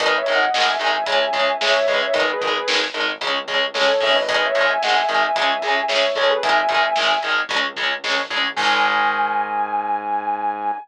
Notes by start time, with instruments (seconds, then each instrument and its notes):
0.00 synth bass 1 G#1, overdriven guitar D#3 G#3, distortion guitar B4 D#5, kick, closed hi-hat
0.17 distortion guitar C#5 E5
0.26 synth bass 1 G#1, overdriven guitar D#3 G#3, closed hi-hat
0.35 distortion guitar D#5 F#5
0.54 synth bass 1 G#1, overdriven guitar D#3 G#3, distortion guitar D#5 F#5, snare
0.68 distortion guitar E5 G#5
0.79 synth bass 1 G#1, overdriven guitar D#3 G#3, closed hi-hat
1.06 synth bass 1 C#2, overdriven guitar C#3 G#3, kick, closed hi-hat
1.33 synth bass 1 C#2, overdriven guitar C#3 G#3, kick, closed hi-hat
1.61 synth bass 1 C#2, overdriven guitar C#3 G#3, distortion guitar C#5 E5, snare
1.86 synth bass 1 C#2, overdriven guitar C#3 G#3, distortion guitar B4 D#5, kick, closed hi-hat
2.01 distortion guitar C#5 E5
2.14 synth bass 1 G#1, overdriven guitar D#3 G#3, distortion guitar B4 D#5, kick, closed hi-hat
2.33 distortion guitar G#4 B4
2.41 synth bass 1 G#1, overdriven guitar D#3 G#3, kick, closed hi-hat
2.49 distortion guitar G#4 B4
2.67 synth bass 1 G#1, overdriven guitar D#3 G#3, distortion guitar G#4 B4, snare
2.94 synth bass 1 G#1, overdriven guitar D#3 G#3, closed hi-hat
3.21 synth bass 1 C#2, overdriven guitar C#3 G#3, kick, closed hi-hat
3.48 synth bass 1 C#2, overdriven guitar C#3 G#3, kick, closed hi-hat
3.74 synth bass 1 C#2, overdriven guitar C#3 G#3, distortion guitar A4 C#5, snare
4.00 synth bass 1 G#1, overdriven guitar C#3 G#3, distortion guitar C#5 E5, kick, open hi-hat
4.15 distortion guitar B4 D#5
4.28 overdriven guitar D#3 G#3, distortion guitar B4 D#5, kick, closed hi-hat
4.46 distortion guitar C#5 E5
4.55 synth bass 1 G#1, overdriven guitar D#3 G#3, closed hi-hat
4.65 distortion guitar E5 G#5
4.82 synth bass 1 G#1, overdriven guitar D#3 G#3, distortion guitar D#5 F#5, snare
4.95 distortion guitar E5 G#5
5.09 synth bass 1 G#1, overdriven guitar D#3 G#3, closed hi-hat
5.36 synth bass 1 C#2, overdriven guitar C#3 G#3, kick, closed hi-hat
5.62 synth bass 1 C#2, overdriven guitar C#3 G#3, closed hi-hat
5.88 synth bass 1 C#2, overdriven guitar C#3 G#3, distortion guitar C#5 E5, snare
6.15 synth bass 1 C#2, overdriven guitar C#3 G#3, distortion guitar A4 C#5, kick, closed hi-hat
6.29 distortion guitar G#4 B4
6.43 synth bass 1 G#1, overdriven guitar D#3 G#3, distortion guitar E5 G#5, kick, closed hi-hat
6.69 synth bass 1 G#1, overdriven guitar D#3 G#3, kick, closed hi-hat
6.96 synth bass 1 G#1, overdriven guitar D#3 G#3, snare
7.23 synth bass 1 G#1, overdriven guitar D#3 G#3, closed hi-hat
7.49 synth bass 1 C#2, overdriven guitar C#3 G#3, kick, closed hi-hat
7.76 synth bass 1 C#2, overdriven guitar C#3 G#3, kick, closed hi-hat
8.04 synth bass 1 A#1, overdriven guitar C#3 G#3, snare
8.29 synth bass 1 A1, overdriven guitar C#3 G#3, kick, closed hi-hat
8.56 synth bass 1 G#2, overdriven guitar D#3 G#3, distortion guitar G#5, kick, crash